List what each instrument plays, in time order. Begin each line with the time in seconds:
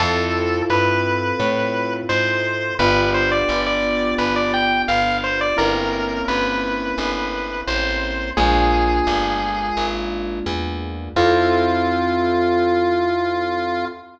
0.00 electric bass (finger) F2, acoustic grand piano C4 E4 F4 A4, lead 1 (square) A4
0.70 electric bass (finger) G2, lead 1 (square) B4
1.40 electric bass (finger) A2
2.09 electric bass (finger) G#2, lead 1 (square) C5
2.79 electric bass (finger) G1, acoustic grand piano B3 D4 F4 G4, lead 1 (square) B4
3.14 lead 1 (square) C5
3.32 lead 1 (square) D5
3.49 electric bass (finger) G1
3.66 lead 1 (square) D5
4.18 electric bass (finger) G1, lead 1 (square) B4
4.36 lead 1 (square) D5
4.54 lead 1 (square) G5
4.88 electric bass (finger) G1, lead 1 (square) F5
5.24 lead 1 (square) C5
5.41 lead 1 (square) D5
5.57 electric bass (finger) G1, acoustic grand piano A#3 C4 C#4 E4, lead 1 (square) A#4
6.28 electric bass (finger) G1, lead 1 (square) B4
6.98 electric bass (finger) G1
7.67 electric bass (finger) A1, lead 1 (square) C5
8.37 electric bass (finger) A#1, acoustic grand piano G#3 A#3 D4 F4, lead 1 (square) G#4
9.07 electric bass (finger) G1
9.77 electric bass (finger) G#1
10.46 electric bass (finger) E2
11.16 electric bass (finger) F2, acoustic grand piano C4 E4 F4 A4, lead 1 (square) F4